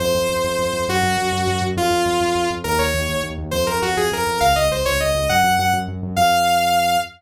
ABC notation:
X:1
M:6/8
L:1/8
Q:3/8=136
K:Fphr
V:1 name="Lead 2 (sawtooth)"
c6 | G6 | F6 | B d3 z2 |
c B G A B2 | f e c d e2 | g2 g z3 | f6 |]
V:2 name="Synth Bass 1" clef=bass
F,, F,, F,, F,, F,, F,, | G,, G,, G,, G,, G,, G,, | F,, F,, F,, F,, F,, F,, | E,, E,, E,, E,, E,, E,, |
F,, F,, F,, F,, F,, F,, | D,, D,, D,, D,, D,, D,, | G,, G,, G,, G,, G,, G,, | F,,6 |]